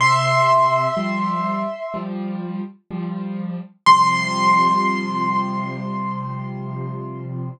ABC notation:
X:1
M:4/4
L:1/8
Q:1/4=62
K:C
V:1 name="Acoustic Grand Piano"
[ec']5 z3 | c'8 |]
V:2 name="Acoustic Grand Piano" clef=bass
C,2 [F,G,]2 [F,G,]2 [F,G,]2 | [C,F,G,]8 |]